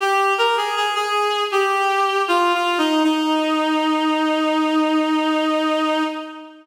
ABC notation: X:1
M:4/4
L:1/16
Q:1/4=79
K:Eb
V:1 name="Clarinet"
G2 B A A A3 G4 (3F2 F2 E2 | E16 |]